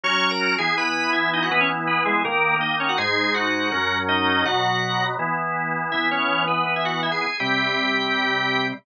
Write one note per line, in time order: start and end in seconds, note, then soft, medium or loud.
0.04 0.56 F#3 medium
0.04 0.56 C#4 medium
0.04 0.56 F#4 medium
0.04 0.30 C#5 loud
0.04 0.30 C#6 loud
0.31 0.55 A#4 medium
0.31 0.55 A#5 medium
0.58 1.49 E3 medium
0.58 1.49 B3 medium
0.58 1.49 E4 medium
0.58 0.75 G#4 medium
0.58 0.75 G#5 loud
0.77 1.11 B4 medium
0.77 1.11 B5 medium
1.13 1.30 E4 medium
1.13 1.30 E5 medium
1.33 1.42 D#4 medium
1.33 1.42 D#5 medium
1.42 1.51 F#4 medium
1.42 1.51 F#5 medium
1.51 2.23 E3 medium
1.51 2.23 B3 medium
1.51 1.60 B3 loud
1.51 2.23 E4 medium
1.51 1.60 B4 loud
1.61 1.69 C#4 medium
1.61 1.69 C#5 loud
1.87 2.03 B3 medium
1.87 2.03 B4 medium
2.05 2.23 G#3 medium
2.05 2.23 G#4 medium
2.25 2.97 D#3 medium
2.25 2.97 A#3 medium
2.25 2.55 A#3 medium
2.25 2.97 D#4 medium
2.25 2.55 A#4 loud
2.61 2.76 D#4 medium
2.61 2.76 D#5 medium
2.80 2.88 C#4 medium
2.80 2.88 C#5 medium
2.89 2.98 F#4 medium
2.89 2.98 F#5 medium
2.98 3.70 G#2 medium
2.98 3.70 G#3 medium
2.98 3.70 D#4 medium
2.98 3.33 G#4 medium
2.98 3.33 G#5 loud
3.34 3.98 F#4 medium
3.34 3.98 F#5 medium
3.72 4.44 F#2 medium
3.72 4.44 F#3 medium
3.72 4.44 C#4 medium
4.09 4.44 D#4 medium
4.09 4.44 D#5 loud
4.45 5.17 B2 medium
4.45 5.17 F#3 medium
4.45 5.17 B3 medium
4.45 5.04 F#4 loud
4.45 5.04 F#5 loud
5.19 5.91 E3 medium
5.19 5.91 B3 medium
5.19 5.91 E4 medium
5.92 7.26 E3 medium
5.92 7.26 B3 medium
5.92 6.08 E4 medium
5.92 6.08 E5 medium
6.11 6.44 C#4 medium
6.11 6.44 C#5 medium
6.48 6.64 B3 medium
6.48 6.64 B4 medium
6.66 6.74 B3 medium
6.66 6.74 B4 medium
6.76 6.85 E4 medium
6.76 6.85 E5 medium
6.85 7.01 F#4 medium
6.85 7.01 F#5 medium
7.03 7.11 E4 medium
7.03 7.11 E5 medium
7.12 7.20 G#4 medium
7.12 7.20 G#5 medium
7.21 7.37 G#4 medium
7.21 7.37 G#5 medium
7.40 8.72 C3 medium
7.40 8.72 G3 medium
7.40 8.72 C4 medium
7.40 8.66 G4 medium
7.40 8.66 G5 loud